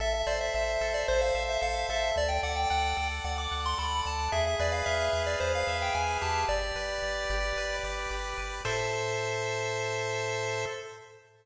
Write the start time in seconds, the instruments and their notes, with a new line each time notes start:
0.00 synth bass 1 A1, lead 1 (square) A4 E5
0.14 lead 1 (square) E5
0.27 synth bass 1 A1, lead 1 (square) C5 D5
0.41 lead 1 (square) E5
0.54 synth bass 1 A1, lead 1 (square) E5
0.81 synth bass 1 A1, lead 1 (square) A4
0.94 lead 1 (square) D5
1.08 synth bass 1 A1, lead 1 (square) C5
1.21 lead 1 (square) F5
1.35 synth bass 1 A1, lead 1 (square) E5
1.49 lead 1 (square) E5
1.62 synth bass 1 A1, lead 1 (square) A4 F5
1.89 synth bass 1 A1, lead 1 (square) A4 E5
2.16 synth bass 1 D2, lead 1 (square) D5
2.28 lead 1 (square) G5
2.43 synth bass 1 D2, lead 1 (square) D5 F#5
2.56 lead 1 (square) G5
2.70 synth bass 1 D2, lead 1 (square) F#5 G5
2.97 synth bass 1 D2, lead 1 (square) A4
3.24 synth bass 1 D2, lead 1 (square) D5 F#5
3.38 lead 1 (square) D6
3.51 synth bass 1 D2, lead 1 (square) F#5
3.66 lead 1 (square) C6
3.78 synth bass 1 D2, lead 1 (square) A4 B5
4.05 synth bass 1 D2, lead 1 (square) D5 A5
4.32 synth bass 1 E2, lead 1 (square) G#4 E5
4.47 lead 1 (square) E5
4.59 synth bass 1 E2, lead 1 (square) B4 D5
4.72 lead 1 (square) F5
4.86 synth bass 1 E2, lead 1 (square) E5 F5
5.13 synth bass 1 E2, lead 1 (square) G#4
5.26 lead 1 (square) D5
5.40 synth bass 1 E2, lead 1 (square) B4 C5
5.55 lead 1 (square) F5
5.67 synth bass 1 E2, lead 1 (square) E5
5.82 lead 1 (square) G5
5.94 synth bass 1 E2, lead 1 (square) G#4 G#5
6.21 synth bass 1 E2, lead 1 (square) G4 A5
6.49 synth bass 1 G1, lead 1 (square) D5
6.75 synth bass 1 G1, lead 1 (square) B4
7.02 synth bass 1 G1, lead 1 (square) D5
7.30 synth bass 1 G1, lead 1 (square) G4
7.56 synth bass 1 G1, lead 1 (square) B4
7.83 synth bass 1 G1, lead 1 (square) D5
8.11 synth bass 1 G1, lead 1 (square) G4
8.38 synth bass 1 G1, lead 1 (square) B4
8.65 synth bass 1 A2, lead 1 (square) A4 C5 E5